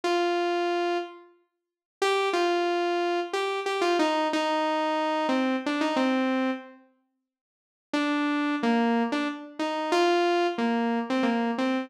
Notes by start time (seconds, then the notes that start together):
0.04 F4
2.02 G4
2.33 F4
3.33 G4
3.66 G4
3.81 F4
3.99 D#4
4.33 D#4
5.29 C4
5.66 D4
5.81 D#4
5.96 C4
7.93 D4
8.63 A#3
9.12 D4
9.59 D#4
9.92 F4
10.58 A#3
11.10 C4
11.23 A#3
11.58 C4